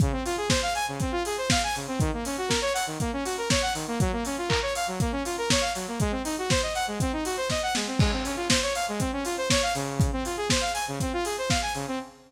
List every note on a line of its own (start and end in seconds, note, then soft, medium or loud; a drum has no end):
0.00 0.12 C#3 loud
0.00 kick loud
0.00 closed hi-hat loud
0.12 0.23 C4 medium
0.25 0.36 F4 loud
0.25 open hi-hat medium
0.37 0.49 G#4 medium
0.49 0.61 C5 loud
0.49 kick loud
0.49 snare loud
0.62 0.74 F5 loud
0.75 0.86 G#5 loud
0.75 open hi-hat medium
0.88 0.99 C#3 medium
1.00 1.12 C4 medium
1.00 kick loud
1.00 closed hi-hat loud
1.12 1.23 F4 loud
1.25 1.37 G#4 medium
1.25 open hi-hat loud
1.38 1.49 C5 medium
1.50 1.62 F5 loud
1.50 kick loud
1.50 snare loud
1.64 1.75 G#5 medium
1.75 1.87 C#3 medium
1.75 open hi-hat medium
1.88 1.99 C4 medium
2.00 2.11 D#3 loud
2.00 kick loud
2.00 closed hi-hat loud
2.13 2.24 A#3 medium
2.25 2.37 C#4 medium
2.25 open hi-hat loud
2.38 2.49 F#4 medium
2.48 2.60 A#4 medium
2.48 kick medium
2.48 snare loud
2.62 2.73 C#5 loud
2.74 2.85 F#5 medium
2.74 open hi-hat loud
2.87 2.98 D#3 medium
3.00 3.11 A#3 loud
3.00 kick loud
3.00 closed hi-hat loud
3.13 3.24 C#4 medium
3.25 3.36 F#4 medium
3.25 open hi-hat loud
3.38 3.49 A#4 medium
3.50 3.62 C#5 loud
3.50 kick loud
3.50 snare loud
3.62 3.73 F#5 loud
3.74 3.86 D#3 medium
3.74 open hi-hat loud
3.87 3.99 A#3 loud
4.00 4.12 F#3 loud
4.00 kick loud
4.00 closed hi-hat loud
4.12 4.24 A#3 medium
4.25 4.37 C#4 medium
4.25 open hi-hat loud
4.38 4.49 F4 medium
4.49 4.60 A#4 loud
4.49 kick loud
4.49 clap loud
4.62 4.73 C#5 medium
4.75 4.87 F5 medium
4.75 open hi-hat loud
4.88 4.99 F#3 medium
5.00 5.12 A#3 loud
5.00 kick loud
5.00 closed hi-hat loud
5.12 5.23 C#4 medium
5.25 5.36 F4 medium
5.25 open hi-hat loud
5.38 5.49 A#4 medium
5.50 5.62 C#5 loud
5.50 kick loud
5.50 snare loud
5.61 5.73 F5 medium
5.75 5.86 F#3 medium
5.75 open hi-hat medium
5.88 5.99 A#3 medium
6.00 6.12 G#3 loud
6.00 kick loud
6.00 closed hi-hat loud
6.11 6.22 C4 medium
6.24 6.36 D#4 medium
6.24 open hi-hat loud
6.38 6.49 F#4 medium
6.50 6.61 C5 loud
6.50 kick loud
6.50 snare loud
6.62 6.74 D#5 medium
6.75 6.86 F#5 loud
6.75 open hi-hat medium
6.87 6.99 G#3 medium
7.00 7.12 C4 loud
7.00 kick loud
7.00 closed hi-hat loud
7.13 7.24 D#4 medium
7.25 7.36 F#4 medium
7.25 open hi-hat loud
7.37 7.48 C5 loud
7.50 7.62 D#5 medium
7.50 kick medium
7.50 snare loud
7.63 7.74 F#5 loud
7.75 7.87 G#3 medium
7.75 snare loud
7.87 7.98 C4 medium
7.99 8.11 G#3 loud
7.99 kick loud
7.99 crash loud
8.12 8.24 C4 medium
8.24 8.36 C#4 medium
8.24 open hi-hat medium
8.36 8.48 F4 medium
8.50 8.61 C5 medium
8.50 kick medium
8.50 snare loud
8.62 8.74 C#5 medium
8.75 8.86 F5 medium
8.75 open hi-hat loud
8.88 9.00 G#3 loud
9.00 9.11 C4 loud
9.00 kick loud
9.00 closed hi-hat loud
9.13 9.24 C#4 medium
9.25 9.36 F4 medium
9.25 open hi-hat loud
9.37 9.49 C5 loud
9.50 9.62 C#5 loud
9.50 kick loud
9.50 snare loud
9.62 9.74 F5 loud
9.75 10.11 C#3 loud
9.75 open hi-hat loud
10.00 kick loud
10.00 closed hi-hat loud
10.12 10.24 C4 medium
10.25 10.37 F4 medium
10.25 open hi-hat medium
10.37 10.48 G#4 medium
10.50 10.62 C5 medium
10.50 kick loud
10.50 snare loud
10.61 10.72 F5 medium
10.74 10.85 G#5 medium
10.74 open hi-hat loud
10.88 10.99 C#3 loud
11.00 11.12 C4 medium
11.00 kick loud
11.00 closed hi-hat loud
11.13 11.24 F4 loud
11.25 11.36 G#4 medium
11.25 open hi-hat loud
11.38 11.49 C5 medium
11.50 11.61 F5 medium
11.50 kick loud
11.50 snare loud
11.62 11.73 G#5 medium
11.74 11.86 C#3 loud
11.74 open hi-hat medium
11.88 11.99 C4 medium